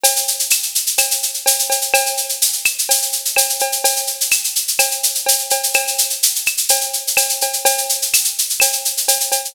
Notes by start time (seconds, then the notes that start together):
0.03 cowbell, shaker
0.16 shaker
0.28 shaker
0.39 shaker
0.50 claves, shaker
0.63 shaker
0.75 shaker
0.87 shaker
0.98 cowbell, claves, shaker
1.11 shaker
1.23 shaker
1.34 shaker
1.46 cowbell, shaker
1.59 shaker
1.70 cowbell, shaker
1.81 shaker
1.94 cowbell, claves, shaker
2.06 shaker
2.17 shaker
2.29 shaker
2.42 shaker
2.53 shaker
2.65 claves, shaker
2.78 shaker
2.89 cowbell, shaker
3.02 shaker
3.12 shaker
3.25 shaker
3.36 cowbell, claves, shaker
3.49 shaker
3.59 cowbell, shaker
3.72 shaker
3.84 cowbell, shaker
3.96 shaker
4.07 shaker
4.21 shaker
4.31 claves, shaker
4.44 shaker
4.55 shaker
4.68 shaker
4.79 cowbell, claves, shaker
4.91 shaker
5.03 shaker
5.15 shaker
5.26 cowbell, shaker
5.39 shaker
5.50 cowbell, shaker
5.63 shaker
5.74 cowbell, claves, shaker
5.87 shaker
5.98 shaker
6.10 shaker
6.23 shaker
6.35 shaker
6.46 claves, shaker
6.57 shaker
6.69 cowbell, shaker
6.81 shaker
6.93 shaker
7.07 shaker
7.17 cowbell, claves, shaker
7.29 shaker
7.41 cowbell, shaker
7.53 shaker
7.65 cowbell, shaker
7.78 shaker
7.89 shaker
8.02 shaker
8.13 claves, shaker
8.24 shaker
8.38 shaker
8.50 shaker
8.60 cowbell, claves, shaker
8.73 shaker
8.85 shaker
8.97 shaker
9.08 cowbell, shaker
9.20 shaker
9.32 cowbell, shaker
9.45 shaker